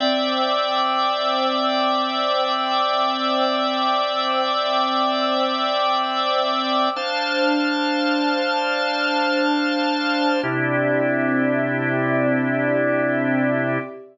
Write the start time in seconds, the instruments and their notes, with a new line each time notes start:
0.00 drawbar organ C4 D5 E5 G5, pad 2 (warm) C5 G5 D6 E6
6.96 drawbar organ D4 C5 F5 A5, pad 2 (warm) D4 C5 A5 F6
10.43 drawbar organ C3 D4 E4 G4, pad 2 (warm) C4 G4 D5 E5